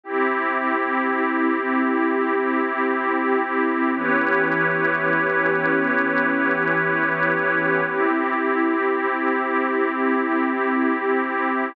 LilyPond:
<<
  \new Staff \with { instrumentName = "Pad 2 (warm)" } { \time 4/4 \key e \minor \tempo 4 = 123 <c' e' g'>1~ | <c' e' g'>1 | <e b cis' g'>1~ | <e b cis' g'>1 |
<c' e' g'>1~ | <c' e' g'>1 | }
  \new Staff \with { instrumentName = "Pad 5 (bowed)" } { \time 4/4 \key e \minor <c' e' g'>1~ | <c' e' g'>1 | <e' g' b' cis''>1~ | <e' g' b' cis''>1 |
<c' e' g'>1~ | <c' e' g'>1 | }
>>